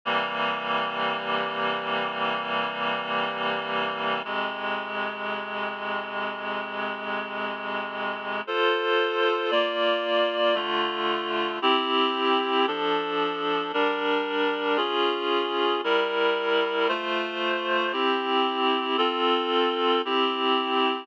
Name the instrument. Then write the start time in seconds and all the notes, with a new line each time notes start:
clarinet
0.05 C3 E3 G3 A#3
4.24 F2 C3 G#3
8.47 F4 A4 C5
9.51 A#3 F4 D5
10.55 D3 A3 F4
11.62 C4 E4 G4
12.67 F3 D4 A4
13.73 G3 D4 A#4
14.77 C#4 F4 G#4
15.84 G3 E4 A#4
16.88 A3 F4 C5
17.92 C4 E4 G4
18.97 C4 F4 A4
20.05 C4 E4 G4